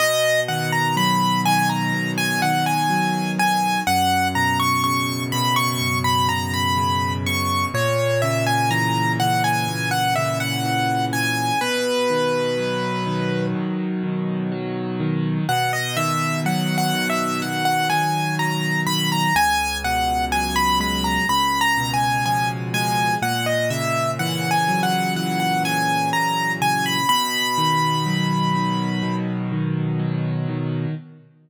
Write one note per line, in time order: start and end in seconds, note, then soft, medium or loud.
0.00 1.93 B2 medium
0.00 0.40 D#5 medium
0.48 1.45 D#3 medium
0.48 0.71 F#5 medium
0.72 0.95 A#5 medium
0.97 2.89 F#3 medium
0.97 1.41 B5 medium
1.46 2.42 D#3 medium
1.46 1.69 G#5 medium
1.69 2.11 A#5 medium
1.93 3.77 B2 medium
2.18 2.41 G#5 medium
2.42 3.38 D#3 medium
2.42 2.65 F#5 medium
2.66 3.31 G#5 medium
2.90 3.82 F#3 medium
3.39 3.84 D#3 medium
3.39 3.80 G#5 medium
3.87 5.81 F#2 medium
3.87 4.28 F#5 medium
4.35 5.32 B2 medium
4.35 4.58 A#5 medium
4.59 4.82 C#6 medium
4.84 6.77 C#3 medium
4.84 5.23 C#6 medium
5.32 6.29 B2 medium
5.32 5.55 B5 medium
5.56 5.98 C#6 medium
5.81 7.65 F#2 medium
6.04 6.27 B5 medium
6.29 7.26 B2 medium
6.29 6.52 A#5 medium
6.54 7.13 B5 medium
6.77 7.69 C#3 medium
7.26 7.72 B2 medium
7.26 7.66 C#6 medium
7.74 9.68 A#2 loud
7.74 8.21 C#5 medium
8.22 9.19 C#3 medium
8.22 8.45 E5 medium
8.47 8.70 G#5 medium
8.71 10.64 E3 medium
8.71 9.12 A#5 medium
9.20 10.16 C#3 medium
9.20 9.43 F#5 medium
9.44 9.89 G#5 medium
9.68 11.52 A#2 medium
9.91 10.14 F#5 medium
10.16 11.13 C#3 medium
10.16 10.39 E5 medium
10.40 11.05 F#5 medium
10.64 11.56 E3 medium
11.13 11.59 C#3 medium
11.13 11.60 G#5 medium
11.61 13.54 B2 medium
11.61 13.46 B4 medium
12.10 13.06 D#3 medium
12.57 14.51 F#3 medium
13.06 14.03 D#3 medium
13.55 15.39 B2 medium
14.03 15.00 D#3 medium
14.52 15.44 F#3 medium
15.00 15.46 D#3 medium
15.49 17.42 B2 loud
15.49 15.72 F#5 medium
15.73 15.96 D#5 medium
15.97 16.93 D#3 medium
15.97 16.40 E5 medium
16.45 18.39 F#3 medium
16.45 16.77 F#5 medium
16.78 17.08 F#5 medium
16.93 17.89 D#3 medium
17.09 17.40 E5 medium
17.42 19.27 B2 medium
17.42 17.65 F#5 medium
17.65 17.88 F#5 medium
17.90 18.86 D#3 medium
17.90 18.35 G#5 medium
18.39 19.31 F#3 medium
18.39 18.81 A#5 medium
18.86 19.33 D#3 medium
18.86 19.09 B5 medium
19.12 19.35 A#5 medium
19.35 21.19 C#2 loud
19.35 19.78 G#5 medium
19.84 21.22 B2 medium
19.84 20.25 F#5 medium
20.32 21.25 F#3 medium
20.32 20.55 G#5 medium
20.56 20.79 B5 medium
20.80 21.26 G#3 medium
20.80 21.04 B5 medium
21.04 21.27 A#5 medium
21.29 23.13 C#2 loud
21.29 21.60 B5 medium
21.61 21.92 A#5 medium
21.78 23.16 B2 medium
21.94 22.24 G#5 medium
22.26 23.18 F3 medium
22.26 22.49 G#5 medium
22.74 23.20 G#3 medium
22.74 23.15 G#5 medium
23.22 26.12 A#2 medium
23.22 23.46 F#5 medium
23.46 23.69 D#5 medium
23.70 25.63 C#3 medium
23.70 24.11 E5 medium
24.19 25.16 E3 medium
24.19 24.50 F#5 medium
24.51 24.81 G#5 medium
24.68 26.98 F#3 medium
24.83 25.14 F#5 medium
25.16 27.00 E3 medium
25.16 25.39 F#5 medium
25.40 25.63 F#5 medium
25.64 26.60 C#3 medium
25.64 26.09 G#5 medium
26.13 27.05 A#2 medium
26.13 26.52 A#5 medium
26.60 27.06 C#3 medium
26.60 26.85 G#5 medium
26.86 27.08 B5 medium
27.09 29.02 B2 medium
27.09 29.15 B5 medium
27.58 28.55 D#3 medium
28.06 29.99 F#3 medium
28.55 29.52 D#3 medium
29.02 30.86 B2 medium
29.52 30.48 D#3 medium
29.99 30.91 F#3 medium
30.49 30.95 D#3 medium